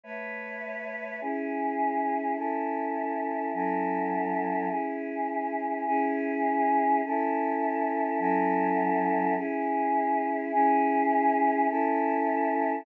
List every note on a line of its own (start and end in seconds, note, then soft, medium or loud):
0.04 1.19 A3 medium
0.04 1.19 B4 medium
0.04 1.19 C#5 medium
0.04 1.19 E5 medium
1.21 2.36 C#4 loud
1.21 2.36 E4 medium
1.21 2.36 G#4 medium
2.36 3.52 C#4 medium
2.36 3.52 E4 medium
2.36 3.52 A4 medium
3.53 4.69 F#3 medium
3.53 4.69 C#4 medium
3.53 4.69 E4 medium
3.53 4.69 A4 loud
4.69 5.85 C#4 medium
4.69 5.85 E4 medium
4.69 5.85 G#4 medium
5.86 7.01 C#4 loud
5.86 7.01 E4 loud
5.86 7.01 G#4 loud
7.05 8.18 C#4 loud
7.05 8.18 E4 loud
7.05 8.18 A4 loud
8.19 9.34 F#3 loud
8.19 9.34 C#4 loud
8.19 9.34 E4 loud
8.19 9.34 A4 loud
9.36 10.51 C#4 loud
9.36 10.51 E4 loud
9.36 10.51 G#4 loud
10.52 11.67 C#4 loud
10.52 11.67 E4 loud
10.52 11.67 G#4 loud
11.69 12.84 C#4 loud
11.69 12.84 E4 loud
11.69 12.84 A4 loud